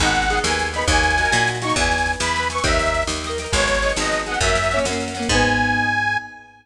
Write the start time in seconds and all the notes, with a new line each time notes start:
0.00 G#1 D#4 G#4 F#5, kick, snare
0.04 B3, snare
0.15 snare
0.22 snare
0.30 D#4 G#4, snare
0.35 B3, snare
0.44 D#2 D#4 G#4 G#5, snare
0.49 B3, snare
0.59 snare
0.66 snare
0.73 D#4 G#4 B5, snare
0.78 B3, snare
0.88 D#2 D#4 F#4 G#5, kick, snare
0.93 A#3, snare
1.03 snare
1.10 snare
1.18 D#4 F#4, snare
1.23 A#3, snare
1.32 A#2 D#4 F#4, snare
1.37 A#3, snare
1.47 snare
1.55 snare
1.61 D#4 F#4 C#6, snare
1.67 A#3, snare
1.76 E2 E5 G#5, kick, snare
1.81 B4, snare
1.91 snare
1.98 snare
2.06 snare
2.13 snare
2.20 E2 B5, snare
2.28 snare
2.34 E5 G#5, snare
2.39 B4, snare
2.50 E5 G#5 C#6, snare
2.55 B4, snare
2.64 D#2 D#5 E5 G5, kick, snare
2.69 A#4, snare
2.79 snare
2.86 snare
2.94 snare
3.02 snare
3.07 D#2, snare
3.16 snare
3.24 D#5 G5, snare
3.29 A#4, snare
3.38 D#5 G5, snare
3.44 A#4, snare
3.52 G#1 D#4 G#4 C#5, kick, snare
3.57 B3, snare
3.67 snare
3.74 snare
3.82 D#4 G#4, snare
3.88 B3, snare
3.96 G#1 D#4 G#4 D#5, snare
4.02 B3, snare
4.12 snare
4.19 snare
4.26 D#4 G#4 F#5, snare
4.31 B3, snare
4.40 F#2 F#4 E5, kick, snare
4.44 A#3 C#4
4.49 snare
4.55 snare
4.63 snare
4.71 C#4 F#4, snare
4.76 A#3, snare
4.85 F#2 C#4 F#4, snare
4.91 A#3, snare
5.00 snare
5.08 snare
5.14 C#4 F#4, snare
5.19 A#3, snare
5.29 G#2 D#4 G#4 G#5, kick, crash
5.34 B3